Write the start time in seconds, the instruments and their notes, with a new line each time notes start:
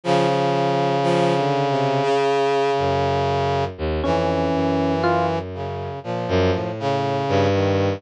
0.04 brass section C#3, violin F3
0.28 violin F3
1.03 violin F3
1.36 violin D3
1.70 violin C3
2.03 violin C#3
2.78 violin F#2
3.78 violin D#2
4.03 violin F2, brass section E3, electric piano 1 C#4
4.54 violin F#2
5.04 electric piano 1 F4
5.54 brass section C#3
6.04 violin A#2, brass section F3
6.28 violin F#2
6.54 violin A2
6.80 brass section C#3
7.29 violin G2
7.53 brass section D#3